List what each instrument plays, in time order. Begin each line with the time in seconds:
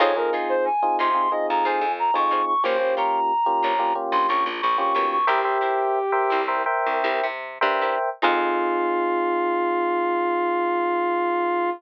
0.00 electric bass (finger) F2, electric piano 1 C4 D#4 F4 G#4, pizzicato strings D#4 F4 G#4 C5, brass section C#5
0.16 electric piano 1 C4 D#4 F4 G#4, brass section A#4
0.33 pizzicato strings D#4 F4 G#4 C5
0.49 brass section C5
0.65 brass section G#5
0.82 electric piano 1 C4 D#4 F4 G#4
0.99 electric bass (finger) C3, pizzicato strings D#4 F4 G#4 C5, brass section C6
1.14 electric piano 1 C4 D#4 F4 G#4
1.30 electric piano 1 C4 D#4 F4 G#4, brass section D#5
1.50 electric bass (finger) F2, brass section A#5
1.64 electric bass (finger) F2, pizzicato strings D#4 F4 G#4 C5, brass section G#5
1.81 electric bass (finger) F2
1.99 brass section A#5
2.14 electric bass (finger) F2, electric piano 1 C4 D#4 F4 G#4, brass section C#6
2.31 pizzicato strings D#4 F4 G#4 C5
2.47 brass section C#6
2.63 electric bass (finger) A#1, electric piano 1 A#3 C#4 F4 G4, pizzicato strings F4 G4 A#4 C#5, brass section C5
2.79 electric piano 1 A#3 C#4 F4 G4
2.97 pizzicato strings F4 G4 A#4 C#5, brass section A#5
3.46 electric piano 1 A#3 C#4 F4 G4
3.63 electric bass (finger) A#1, pizzicato strings F4 G4 A#4 C#5
3.79 electric piano 1 A#3 C#4 F4 G4
3.95 electric piano 1 A#3 C#4 F4 G4
4.12 electric bass (finger) A#1, brass section C6
4.28 electric bass (finger) A#1, pizzicato strings F4 G4 A#4 C#5, brass section C#6
4.46 electric bass (finger) A#1
4.61 electric bass (finger) A#1, brass section C#6
4.78 electric piano 1 A#3 C#4 F4 G4, brass section C#6
4.95 electric bass (finger) B1, pizzicato strings F4 G4 A#4 C#5
5.11 brass section C#6
5.27 electric bass (finger) C2, pizzicato strings E4 G4 A#4 C5, brass section G4, electric piano 1 A#4 C5 E5 G5
5.44 electric piano 1 A#4 C5 E5 G5
5.61 pizzicato strings E4 G4 A#4 C5
6.12 electric piano 1 A#4 C5 E5 G5
6.30 electric bass (finger) C2, pizzicato strings E4 G4 A#4 C5
6.48 electric piano 1 A#4 C5 E5 G5
6.66 electric piano 1 A#4 C5 E5 G5
6.86 electric bass (finger) C2
7.04 electric bass (finger) C2, pizzicato strings E4 G4 A#4 C5
7.23 electric bass (finger) C3
7.61 electric bass (finger) G2, electric piano 1 A#4 C5 E5 G5
7.81 pizzicato strings E4 G4 A#4 C5
8.22 electric bass (finger) F2, electric piano 1 C4 D#4 F4 G#4, pizzicato strings D#4 F4 G#4 C5, brass section F4